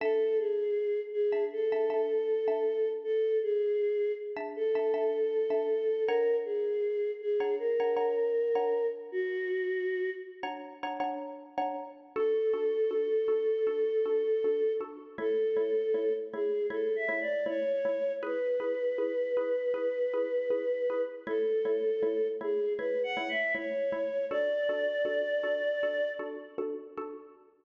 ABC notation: X:1
M:4/4
L:1/16
Q:1/4=79
K:Dlyd
V:1 name="Choir Aahs"
A2 G4 G2 A8 | A2 G4 z2 A8 | ^A2 G4 G2 A8 | F6 z10 |
A16 | A6 G2 (3A2 e2 d2 c4 | B16 | A6 G2 (3B2 f2 e2 c4 |
d10 z6 |]
V:2 name="Xylophone"
[Dea]7 [Dea]2 [Dea] [Dea]3 [Dea]3- | [Dea]7 [Dea]2 [Dea] [Dea]3 [Dea]3 | [Dcf^a]7 [Dcfa]2 [Dcfa] [Dcfa]3 [Dcfa]3- | [Dcf^a]7 [Dcfa]2 [Dcfa] [Dcfa]3 [Dcfa]3 |
[DFA]2 [DFA]2 [DFA]2 [DFA]2 [DFA]2 [DFA]2 [DFA]2 [DFA]2 | [A,Ec]2 [A,Ec]2 [A,Ec]2 [A,Ec]2 [A,Ec]2 [A,Ec]2 [A,Ec]2 [A,Ec]2 | [EGB]2 [EGB]2 [EGB]2 [EGB]2 [EGB]2 [EGB]2 [EGB]2 [EGB]2 | [A,Ec]2 [A,Ec]2 [A,Ec]2 [A,Ec]2 [A,Ec]2 [A,Ec]2 [A,Ec]2 [A,Ec]2 |
[DFA]2 [DFA]2 [DFA]2 [DFA]2 [DFA]2 [DFA]2 [DFA]2 [DFA]2 |]